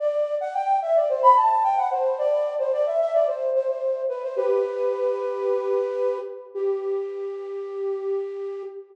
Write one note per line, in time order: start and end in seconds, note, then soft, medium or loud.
0.00 0.35 D5 loud
0.41 0.54 F#5 loud
0.54 0.78 G5 loud
0.82 0.95 E5 loud
0.96 1.09 D5 medium
1.09 1.22 C5 medium
1.23 1.35 B5 loud
1.36 1.63 A5 medium
1.64 1.77 G5 loud
1.77 1.90 F#5 medium
1.91 2.18 C5 medium
2.18 2.54 D5 loud
2.59 2.72 C5 medium
2.73 2.85 D5 loud
2.86 2.99 E5 medium
3.00 3.13 E5 loud
3.14 3.27 D5 loud
3.27 3.50 C5 medium
3.55 3.68 C5 medium
3.68 4.02 C5 medium
4.09 4.22 B4 medium
4.23 4.36 C5 medium
4.36 6.18 G4 loud
4.36 6.18 B4 loud
6.54 8.63 G4 loud